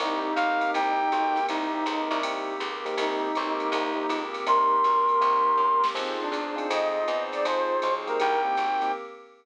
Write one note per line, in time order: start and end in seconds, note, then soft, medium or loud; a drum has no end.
0.00 0.34 C2 loud
0.00 0.30 A#3 medium
0.00 0.36 A#3 medium
0.00 0.30 C4 medium
0.00 0.36 C4 medium
0.00 0.30 D#4 medium
0.00 1.39 D#4 medium
0.00 0.39 D#4 medium
0.00 0.30 G4 medium
0.00 0.36 G4 medium
0.00 kick medium
0.00 ride medium
0.35 0.71 B1 medium
0.35 0.74 A#3 medium
0.35 0.74 C4 medium
0.35 0.74 G4 medium
0.35 0.74 A#4 medium
0.35 0.71 F5 medium
0.35 hi-hat pedal medium
0.35 ride medium
0.61 ride medium
0.74 1.09 C2 loud
0.74 1.12 A#3 medium
0.74 1.06 A#3 medium
0.74 1.12 C4 medium
0.74 1.06 C4 medium
0.74 1.13 D#4 medium
0.74 1.06 D#4 medium
0.74 1.12 G4 medium
0.74 1.06 G4 medium
0.74 1.46 G5 medium
0.74 kick medium
0.74 ride medium
1.12 1.47 B1 medium
1.12 1.49 A#3 medium
1.12 1.49 C4 medium
1.12 1.49 G4 medium
1.12 1.49 A#4 medium
1.12 hi-hat pedal medium
1.12 ride medium
1.36 snare soft
1.36 ride medium
1.49 1.84 C2 loud
1.49 1.66 A#3 medium
1.49 1.87 A#3 medium
1.49 1.66 C4 medium
1.49 1.87 C4 medium
1.49 2.20 D#4 medium
1.49 1.66 D#4 loud
1.49 1.87 D#4 medium
1.49 1.66 G4 medium
1.49 1.87 G4 medium
1.49 ride medium
1.74 1.97 A#3 medium
1.74 1.97 C4 medium
1.74 1.97 D#4 medium
1.74 1.97 G4 medium
1.86 2.09 C#2 medium
1.86 2.24 A#3 medium
1.86 2.24 C4 medium
1.86 2.24 G4 medium
1.86 2.24 A#4 medium
1.86 hi-hat pedal medium
1.86 ride medium
2.11 2.58 C2 loud
2.11 ride medium
2.23 2.53 A#3 medium
2.23 2.61 A#3 medium
2.23 2.53 C4 medium
2.23 2.61 C4 medium
2.23 2.53 D#4 loud
2.23 2.61 D#4 medium
2.23 2.53 G4 medium
2.23 2.61 G4 medium
2.23 ride loud
2.60 2.95 C#2 loud
2.60 2.96 A#3 medium
2.60 2.96 C4 medium
2.60 2.96 G4 medium
2.60 3.00 A#4 medium
2.60 kick soft
2.60 hi-hat pedal medium
2.60 ride medium
2.85 3.28 A#3 loud
2.85 3.28 C4 medium
2.85 3.28 D#4 medium
2.85 3.28 G4 loud
2.85 snare soft
2.85 ride medium
2.97 3.32 C2 loud
2.97 3.34 A#3 medium
2.97 3.34 C4 medium
2.97 3.34 D#4 medium
2.97 4.23 D#4 medium
2.97 3.34 G4 medium
2.97 ride medium
3.34 3.72 B1 loud
3.34 3.71 A#3 medium
3.34 3.66 A#3 medium
3.34 3.71 C4 medium
3.34 3.66 C4 medium
3.34 3.66 D#4 medium
3.34 3.71 G4 medium
3.34 3.66 G4 medium
3.34 3.71 A#4 medium
3.34 kick medium
3.34 hi-hat pedal medium
3.34 ride medium
3.60 ride medium
3.72 4.07 C2 loud
3.72 4.09 A#3 medium
3.72 3.91 A#3 loud
3.72 4.09 C4 medium
3.72 3.91 C4 medium
3.72 4.09 D#4 medium
3.72 3.91 D#4 medium
3.72 4.09 G4 medium
3.72 3.91 G4 medium
3.72 ride medium
3.96 4.18 A#3 medium
3.96 4.18 C4 medium
3.96 4.18 D#4 medium
3.96 4.18 G4 medium
4.09 4.44 C#2 medium
4.09 4.46 A#3 medium
4.09 4.46 C4 medium
4.09 4.46 G4 medium
4.09 4.46 A#4 medium
4.09 hi-hat pedal medium
4.09 ride medium
4.34 snare soft
4.34 ride medium
4.46 4.82 C2 loud
4.46 4.76 A#3 medium
4.46 4.85 A#3 medium
4.46 4.76 C4 medium
4.46 4.85 C4 medium
4.46 4.76 D#4 medium
4.46 4.85 D#4 medium
4.46 4.76 G4 medium
4.46 4.85 G4 medium
4.46 5.85 A#4 medium
4.46 5.87 C6 soft
4.46 ride medium
4.84 5.19 B1 medium
4.84 5.22 A#3 medium
4.84 5.22 C4 medium
4.84 5.22 G4 medium
4.84 5.23 A#4 medium
4.84 hi-hat pedal medium
4.84 ride medium
5.09 ride medium
5.21 5.56 C2 loud
5.21 5.51 A#3 medium
5.21 5.59 A#3 medium
5.21 5.51 C4 medium
5.21 5.59 C4 medium
5.21 5.51 D#4 medium
5.21 5.59 D#4 medium
5.21 5.51 G4 medium
5.21 5.59 G4 medium
5.21 ride medium
5.57 5.92 F#2 medium
5.57 5.97 A#3 medium
5.57 5.94 C4 medium
5.57 5.97 G4 medium
5.57 5.97 A#4 medium
5.57 kick medium
5.84 snare medium
5.94 6.30 F2 loud
5.94 6.24 C4 medium
5.94 6.31 C4 medium
5.94 6.17 C4 medium
5.94 6.24 D#4 medium
5.94 6.31 D#4 medium
5.94 6.24 F4 medium
5.94 6.31 F4 medium
5.94 6.24 G#4 medium
5.94 6.31 G#4 medium
5.94 kick medium
5.94 crash medium
5.94 ride medium
6.21 6.68 D4 medium
6.32 6.67 E2 medium
6.32 6.70 C4 medium
6.32 6.70 D#4 medium
6.32 6.70 G#4 medium
6.32 6.70 C5 medium
6.32 kick medium
6.32 hi-hat pedal medium
6.32 ride medium
6.56 6.98 C4 loud
6.56 6.98 D#4 medium
6.56 6.98 F4 medium
6.56 6.98 G#4 medium
6.56 ride medium
6.70 7.05 F2 loud
6.70 7.07 C4 medium
6.70 7.07 D#4 medium
6.70 7.09 F4 medium
6.70 7.07 G#4 medium
6.70 7.23 D#5 medium
6.70 ride loud
7.07 7.43 E2 medium
7.07 7.44 C4 medium
7.07 7.44 D#4 medium
7.07 7.44 G#4 medium
7.07 7.44 C5 medium
7.07 kick soft
7.07 hi-hat pedal medium
7.07 ride medium
7.32 7.44 D5 medium
7.32 snare soft
7.32 ride medium
7.45 7.80 F2 loud
7.45 7.75 C4 medium
7.45 7.82 C4 medium
7.45 7.75 D#4 medium
7.45 7.82 D#4 medium
7.45 7.75 F4 medium
7.45 7.83 F4 medium
7.45 7.75 G#4 loud
7.45 7.82 G#4 medium
7.45 7.94 C5 medium
7.45 kick soft
7.45 ride medium
7.82 8.18 B1 medium
7.82 8.19 C4 medium
7.82 8.19 D#4 medium
7.82 8.19 G#4 medium
7.82 8.19 C5 medium
7.82 hi-hat pedal medium
7.82 ride medium
8.07 8.37 A#3 loud
8.07 8.37 C4 medium
8.07 8.37 D#4 medium
8.07 8.37 G4 medium
8.07 8.42 A#4 medium
8.07 ride medium
8.20 8.56 C2 loud
8.20 8.57 A#3 medium
8.20 8.57 C4 medium
8.20 8.58 D#4 medium
8.20 8.57 G4 medium
8.20 8.92 G5 medium
8.20 ride medium
8.45 8.67 A#3 medium
8.45 8.67 C4 medium
8.45 8.67 D#4 medium
8.45 8.67 G4 medium
8.57 8.92 G#1 medium
8.57 8.94 A#3 medium
8.57 8.94 C4 medium
8.57 8.94 G4 medium
8.57 8.94 A#4 medium
8.57 kick medium
8.57 hi-hat pedal medium
8.57 ride medium
8.82 8.91 A#3 medium
8.82 8.91 C4 medium
8.82 8.91 D#4 medium
8.82 8.91 G4 medium
8.82 snare soft
8.82 ride medium